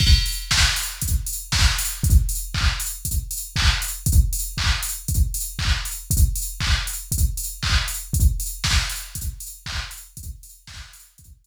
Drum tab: CC |x-------|--------|--------|--------|
HH |-o-oxo-o|xo-oxo-o|xo-oxo-o|xo-oxo-o|
CP |--------|--x---x-|--x---x-|--x---x-|
SD |--o---o-|--------|--------|--------|
BD |o-o-o-o-|o-o-o-o-|o-o-o-o-|o-o-o-o-|

CC |--------|--------|
HH |xo-oxo-o|xo-oxo--|
CP |------x-|--------|
SD |--o-----|--o-----|
BD |o-o-o-o-|o-o-o---|